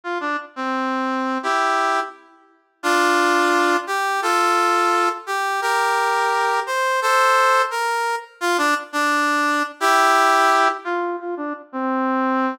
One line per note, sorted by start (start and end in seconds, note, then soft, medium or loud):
0.04 0.18 F4 loud
0.20 0.37 D4 loud
0.56 1.38 C4 loud
1.43 2.00 E4 loud
1.43 2.00 G4 loud
2.83 3.77 D4 loud
2.83 3.77 F4 loud
3.87 4.21 G4 loud
4.22 5.09 F4 loud
4.22 5.09 A4 loud
5.27 5.61 G4 loud
5.61 6.60 G4 loud
5.61 6.60 A#4 loud
6.66 7.00 C5 loud
7.02 7.62 A4 loud
7.02 7.62 C5 loud
7.71 8.15 A#4 loud
8.41 8.57 F4 loud
8.58 8.74 D4 loud
8.93 9.63 D4 loud
9.80 10.68 E4 loud
9.80 10.68 G4 loud
10.85 11.16 F4 loud
11.20 11.35 F4 loud
11.37 11.53 D4 loud
11.72 12.55 C4 loud